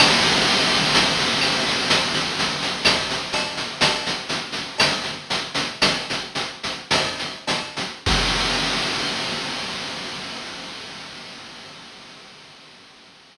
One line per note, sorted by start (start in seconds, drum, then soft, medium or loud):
0.00 crash loud
0.00 cowbell loud
0.00 claves loud
0.24 shaker medium
0.47 shaker medium
0.72 shaker medium
0.94 tambourine medium
0.94 cowbell medium
0.94 shaker loud
1.19 shaker medium
1.41 claves loud
1.41 shaker loud
1.67 shaker medium
1.90 cowbell medium
1.90 shaker loud
2.14 shaker medium
2.39 shaker loud
2.62 shaker medium
2.85 tambourine loud
2.85 cowbell medium
2.85 claves loud
2.85 shaker loud
3.10 shaker medium
3.33 cowbell loud
3.33 shaker loud
3.57 shaker medium
3.81 cowbell loud
3.81 shaker loud
4.06 shaker medium
4.29 shaker medium
4.52 snare medium
4.52 shaker medium
4.78 tambourine medium
4.78 cowbell medium
4.78 claves loud
4.78 shaker loud
5.04 shaker medium
5.30 shaker loud
5.55 shaker loud
5.82 cowbell medium
5.82 claves loud
5.82 shaker loud
6.10 shaker medium
6.35 shaker medium
6.63 shaker medium
6.91 tambourine loud
6.91 cowbell medium
6.91 shaker loud
7.19 shaker medium
7.47 cowbell medium
7.47 shaker loud
7.76 shaker medium
8.06 kick loud
8.06 crash loud